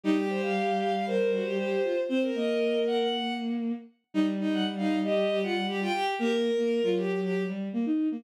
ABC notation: X:1
M:4/4
L:1/16
Q:1/4=117
K:Cdor
V:1 name="Violin"
G8 B2 ^F G G2 =F z | c z e4 _g g3 z6 | z3 _g z f2 e3 ^f2 z =g g z | B6 z10 |]
V:2 name="Violin"
E G c f3 f f c8 | c B7 z8 | E z E2 z E2 G2 G F z G F G2 | G z4 F G2 G2 z6 |]
V:3 name="Violin"
G,16 | C2 B,12 z2 | G,16 | B,3 B,2 ^F,5 G,2 B, E2 B, |]